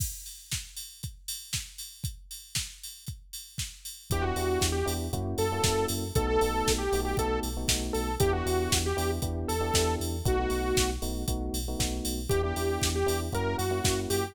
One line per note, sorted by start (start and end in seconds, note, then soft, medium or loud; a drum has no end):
0.00 kick medium
0.00 crash medium
0.26 open hi-hat medium
0.51 kick medium
0.51 snare medium
0.76 open hi-hat medium
1.03 kick medium
1.03 closed hi-hat medium
1.28 open hi-hat medium
1.53 kick medium
1.53 snare medium
1.78 open hi-hat medium
2.04 kick medium
2.04 closed hi-hat medium
2.31 open hi-hat medium
2.55 kick medium
2.55 snare medium
2.83 open hi-hat medium
3.07 kick medium
3.07 closed hi-hat medium
3.33 open hi-hat medium
3.58 kick medium
3.58 snare medium
3.85 open hi-hat medium
4.10 4.32 E2 medium
4.10 4.22 B3 medium
4.10 4.22 D4 medium
4.10 4.22 E4 medium
4.10 4.22 G4 medium
4.10 4.24 G4 loud
4.10 kick medium
4.10 closed hi-hat medium
4.22 4.34 B3 medium
4.22 4.34 D4 medium
4.22 4.34 E4 medium
4.22 4.67 F#4 loud
4.22 4.34 G4 medium
4.36 4.58 E2 medium
4.36 4.77 B3 medium
4.36 4.77 D4 medium
4.36 4.77 E4 medium
4.36 4.77 G4 medium
4.36 open hi-hat medium
4.61 4.83 E2 medium
4.61 kick medium
4.61 snare loud
4.72 4.93 G4 medium
4.86 5.09 E2 medium
4.86 5.06 B3 medium
4.86 5.06 D4 medium
4.86 5.06 E4 medium
4.86 5.06 G4 medium
4.86 open hi-hat medium
5.13 5.35 F#2 medium
5.13 5.44 A#3 medium
5.13 5.44 C#4 medium
5.13 5.44 E4 medium
5.13 5.44 F#4 medium
5.13 kick medium
5.13 closed hi-hat medium
5.38 5.60 F#2 medium
5.38 5.86 A4 loud
5.38 open hi-hat medium
5.52 5.62 A#3 medium
5.52 5.62 C#4 medium
5.52 5.62 E4 medium
5.52 5.62 F#4 medium
5.63 5.86 F#2 medium
5.63 6.04 A#3 medium
5.63 6.04 C#4 medium
5.63 6.04 E4 medium
5.63 6.04 F#4 medium
5.63 kick medium
5.63 snare loud
5.88 6.11 F#2 medium
5.88 open hi-hat medium
6.15 6.37 B1 medium
6.15 6.27 A3 medium
6.15 6.27 B3 medium
6.15 6.27 D#4 medium
6.15 6.27 F#4 medium
6.15 6.26 A4 loud
6.15 kick loud
6.15 closed hi-hat medium
6.27 6.38 A3 medium
6.27 6.38 B3 medium
6.27 6.38 D#4 medium
6.27 6.38 F#4 medium
6.27 6.73 A4 loud
6.41 6.63 B1 medium
6.41 6.82 A3 medium
6.41 6.82 B3 medium
6.41 6.82 D#4 medium
6.41 6.82 F#4 medium
6.41 open hi-hat medium
6.67 6.88 B1 medium
6.67 kick medium
6.67 snare loud
6.78 7.00 G4 medium
6.92 7.14 B1 medium
6.92 7.13 A3 medium
6.92 7.13 B3 medium
6.92 7.13 D#4 medium
6.92 7.13 F#4 medium
6.92 open hi-hat medium
7.05 7.17 G4 loud
7.17 7.40 B1 medium
7.17 7.48 A3 medium
7.17 7.48 B3 medium
7.17 7.48 D#4 medium
7.17 7.48 F#4 medium
7.17 7.40 A4 loud
7.17 kick medium
7.17 closed hi-hat medium
7.43 7.65 B1 medium
7.43 open hi-hat medium
7.57 7.67 A3 medium
7.57 7.67 B3 medium
7.57 7.67 D#4 medium
7.57 7.67 F#4 medium
7.68 7.91 B1 medium
7.68 8.10 A3 medium
7.68 8.10 B3 medium
7.68 8.10 D#4 medium
7.68 8.10 F#4 medium
7.68 kick medium
7.68 snare loud
7.93 8.17 B1 medium
7.93 8.15 A4 medium
7.93 open hi-hat medium
8.20 8.42 E2 medium
8.20 8.31 B3 medium
8.20 8.31 D4 medium
8.20 8.31 E4 medium
8.20 8.32 G4 loud
8.20 8.31 G4 medium
8.20 kick loud
8.20 closed hi-hat loud
8.33 8.43 B3 medium
8.33 8.43 D4 medium
8.33 8.43 E4 medium
8.33 8.78 F#4 loud
8.33 8.43 G4 medium
8.46 8.68 E2 medium
8.46 8.87 B3 medium
8.46 8.87 D4 medium
8.46 8.87 E4 medium
8.46 8.87 G4 medium
8.46 open hi-hat medium
8.72 8.93 E2 medium
8.72 kick medium
8.72 snare loud
8.86 9.11 G4 loud
8.97 9.19 E2 medium
8.97 9.17 B3 medium
8.97 9.17 D4 medium
8.97 9.17 E4 medium
8.97 9.17 G4 medium
8.97 open hi-hat medium
9.22 9.45 E2 medium
9.22 9.53 B3 medium
9.22 9.53 D4 medium
9.22 9.53 E4 medium
9.22 9.53 G4 medium
9.22 kick medium
9.22 closed hi-hat medium
9.48 9.71 E2 medium
9.48 9.95 A4 loud
9.48 open hi-hat medium
9.60 9.71 B3 medium
9.60 9.71 D4 medium
9.60 9.71 E4 medium
9.60 9.71 G4 medium
9.74 9.96 E2 medium
9.74 10.15 B3 medium
9.74 10.15 D4 medium
9.74 10.15 E4 medium
9.74 10.15 G4 medium
9.74 kick medium
9.74 snare loud
10.00 10.22 E2 medium
10.00 open hi-hat medium
10.25 10.47 B1 medium
10.25 10.35 A3 medium
10.25 10.35 B3 medium
10.25 10.35 D#4 medium
10.25 10.35 F#4 medium
10.25 10.90 F#4 loud
10.25 kick loud
10.25 closed hi-hat medium
10.39 10.50 A3 medium
10.39 10.50 B3 medium
10.39 10.50 D#4 medium
10.39 10.50 F#4 medium
10.50 10.73 B1 medium
10.50 10.91 A3 medium
10.50 10.91 B3 medium
10.50 10.91 D#4 medium
10.50 10.91 F#4 medium
10.50 open hi-hat medium
10.77 10.99 B1 medium
10.77 kick medium
10.77 snare loud
11.02 11.25 B1 medium
11.02 11.22 A3 medium
11.02 11.22 B3 medium
11.02 11.22 D#4 medium
11.02 11.22 F#4 medium
11.02 open hi-hat medium
11.28 11.50 B1 medium
11.28 11.59 A3 medium
11.28 11.59 B3 medium
11.28 11.59 D#4 medium
11.28 11.59 F#4 medium
11.28 kick medium
11.28 closed hi-hat loud
11.54 11.75 B1 medium
11.54 open hi-hat medium
11.68 11.78 A3 medium
11.68 11.78 B3 medium
11.68 11.78 D#4 medium
11.68 11.78 F#4 medium
11.79 12.01 B1 medium
11.79 12.20 A3 medium
11.79 12.20 B3 medium
11.79 12.20 D#4 medium
11.79 12.20 F#4 medium
11.79 kick medium
11.79 snare medium
12.05 12.27 B1 medium
12.05 open hi-hat medium
12.29 12.53 E2 medium
12.29 12.41 B3 medium
12.29 12.41 D4 medium
12.29 12.41 E4 medium
12.29 12.42 G4 loud
12.29 12.41 G4 medium
12.29 kick medium
12.29 closed hi-hat medium
12.43 12.54 B3 medium
12.43 12.54 D4 medium
12.43 12.54 E4 medium
12.43 12.89 G4 medium
12.43 12.54 G4 medium
12.56 12.78 E2 medium
12.56 12.98 B3 medium
12.56 12.98 D4 medium
12.56 12.98 E4 medium
12.56 12.98 G4 medium
12.56 open hi-hat medium
12.82 13.04 E2 medium
12.82 kick medium
12.82 snare loud
12.95 13.20 G4 loud
13.06 13.30 E2 medium
13.06 13.27 B3 medium
13.06 13.27 D4 medium
13.06 13.27 E4 medium
13.06 13.27 G4 medium
13.06 open hi-hat medium
13.32 13.55 F#2 medium
13.32 13.64 A#3 medium
13.32 13.64 C#4 medium
13.32 13.64 E4 medium
13.32 13.64 F#4 medium
13.32 13.57 A#4 loud
13.32 kick medium
13.32 closed hi-hat medium
13.58 13.81 F#2 medium
13.58 14.00 F#4 medium
13.58 open hi-hat medium
13.71 13.81 A#3 medium
13.71 13.81 C#4 medium
13.71 13.81 E4 medium
13.71 13.81 F#4 medium
13.84 14.06 F#2 medium
13.84 14.25 A#3 medium
13.84 14.25 C#4 medium
13.84 14.25 E4 medium
13.84 14.25 F#4 medium
13.84 kick medium
13.84 snare loud
14.10 14.32 F#2 medium
14.10 14.34 G4 loud
14.10 open hi-hat medium